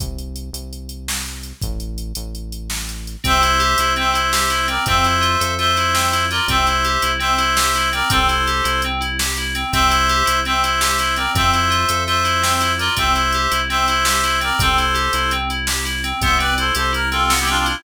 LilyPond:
<<
  \new Staff \with { instrumentName = "Clarinet" } { \time 9/8 \key c \mixolydian \tempo 4. = 111 r1 r8 | r1 r8 | <c'' e''>2 <c'' e''>2 <bes' d''>8 | <c'' e''>2 <c'' e''>2 <bes' d''>8 |
<c'' e''>2 <c'' e''>2 <bes' d''>8 | <a' c''>2~ <a' c''>8 r2 | <c'' e''>2 <c'' e''>2 <bes' d''>8 | <c'' e''>2 <c'' e''>2 <bes' d''>8 |
<c'' e''>2 <c'' e''>2 <bes' d''>8 | <a' c''>2~ <a' c''>8 r2 | <c'' e''>8 <b' d''>8 <a' c''>8 <a' c''>8 bes'8 <f' a'>8. <e' g'>16 <d' f'>16 <d' f'>16 <d' f'>16 <c' e'>16 | }
  \new Staff \with { instrumentName = "Electric Piano 2" } { \time 9/8 \key c \mixolydian r1 r8 | r1 r8 | c'8 e'8 g'8 e'8 c'8 e'8 g'8 e'8 c'8 | c'8 e'8 f'8 a'8 f'8 e'8 c'8 e'8 f'8 |
c'8 e'8 g'8 e'8 c'8 e'8 g'8 e'8 c'8 | c'8 e'8 g'8 e'8 c'8 e'8 g'8 e'8 c'8 | c'8 e'8 g'8 e'8 c'8 e'8 g'8 e'8 c'8 | c'8 e'8 f'8 a'8 f'8 e'8 c'8 e'8 f'8 |
c'8 e'8 g'8 e'8 c'8 e'8 g'8 e'8 c'8 | c'8 e'8 g'8 e'8 c'8 e'8 g'8 e'8 c'8 | b8 c'8 e'8 g'8 e'8 c'8 b8 c'8 e'8 | }
  \new Staff \with { instrumentName = "Synth Bass 1" } { \clef bass \time 9/8 \key c \mixolydian c,4. c,2. | a,,4. a,,2. | c,4. c,2. | f,4. f,2. |
c,4. c,2. | c,4. c,2. | c,4. c,2. | f,4. f,2. |
c,4. c,2. | c,4. c,2. | c,4. c,2. | }
  \new DrumStaff \with { instrumentName = "Drums" } \drummode { \time 9/8 <hh bd>8 hh8 hh8 hh8 hh8 hh8 sn8 hh8 hh8 | <hh bd>8 hh8 hh8 hh8 hh8 hh8 sn8 hh8 hh8 | <hh bd>8 hh8 hh8 hh8 hh8 hh8 sn8 hh8 hh8 | <hh bd>8 hh8 hh8 hh8 hh8 hh8 sn8 hh8 hh8 |
<hh bd>8 hh8 hh8 hh8 hh8 hh8 sn8 hh8 hh8 | <hh bd>8 hh8 hh8 hh8 hh8 hh8 sn8 hh8 hh8 | <hh bd>8 hh8 hh8 hh8 hh8 hh8 sn8 hh8 hh8 | <hh bd>8 hh8 hh8 hh8 hh8 hh8 sn8 hh8 hh8 |
<hh bd>8 hh8 hh8 hh8 hh8 hh8 sn8 hh8 hh8 | <hh bd>8 hh8 hh8 hh8 hh8 hh8 sn8 hh8 hh8 | <hh bd>8 hh8 hh8 hh8 hh8 hh8 sn8 hh8 hh8 | }
>>